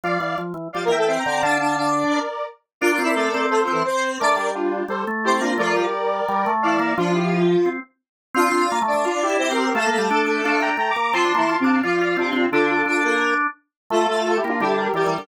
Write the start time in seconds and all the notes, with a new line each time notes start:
0.04 F3 D5 F5
0.20 E3
0.38 F3
0.54 E3
0.73 F3 G3 G4 D5 F5
0.85 E3 A#3 A#4
0.90 E5 G5
0.98 A3 A4
1.07 C4 C5 E5 G5
1.19 G5 A#5
1.25 D3 C4 C5
1.31 G5 A#5
1.42 D3 D4 D5 F5 A5
1.60 D4 D5
1.77 D4 D5
2.12 A#4 D5
2.81 D4 F4 A#4 D5 F5
2.92 F4 F5
2.99 C4
3.04 E4 E5
3.15 A3 A4 A#4 D5
3.34 C4
3.50 A3 A4 C5
3.62 F3 F4
3.67 C4
3.72 E3 E4
3.85 C4 C5
4.20 A3 D4 A#4 D5
4.36 G3
4.54 D4 F4
4.88 G3 A4 C5
5.07 A3
5.24 C4 E4 G4 C5
5.41 A#3 D4 F4
5.58 F3 A3 F4 A#4 D5
5.77 G3
6.28 G3
6.46 A3
6.62 E3 E4 D5 F5
6.79 A#3
6.97 F3 D4 F4
7.14 E4 G4
7.66 C4
8.34 C4 D4 F4 F5
8.52 C4
8.72 A#3
8.82 A3
8.87 D4 D5
8.94 A3
9.05 D4 F4
9.22 E4 G4
9.29 E4
9.38 C4 E4 G4 C5
9.51 C4 G4 A#4
9.63 G4 A#4
9.74 A3 A4 F5 A5
9.86 A#3
9.91 A3 A4
9.98 G3
10.10 D4
10.27 D4
10.44 D4 F5 A5
10.60 D4 G5 A#5
10.77 A3 G5 A#5
10.90 A#5 D6
10.96 A#3
11.02 A#5 D6
11.13 F3 C4 F4 A5 C6
11.24 D4
11.34 E3 A#3 E4
11.49 F4
11.60 C3 C4
11.64 D4 F5 A5
11.83 F3 F4 D5 F5
12.00 F4 D5 F5
12.17 C3 C4 D4 F4
12.33 C4
12.52 D3 D4 F4 A4
12.69 F4 A4
12.86 D4 D5
13.04 A#3 A#4
13.90 A3 F4 A4
14.08 A3 F4 A4
14.25 F4 A4
14.37 E4 G4
14.44 A#3
14.49 D4 F4
14.60 D3 G3 D4 E4 G4
14.77 G4 A#4
14.94 E3 G3 G4 A#4 D5
15.06 E3
15.18 D3